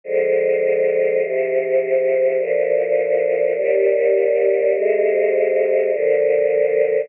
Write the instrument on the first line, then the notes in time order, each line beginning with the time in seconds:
choir aahs
0.04 D3 F3 G#3
1.22 G#2 C3 F3
2.38 D2 A#2 F3
3.56 D#2 A#2 G3
4.73 F2 C3 G#3
5.92 A#2 D3 F3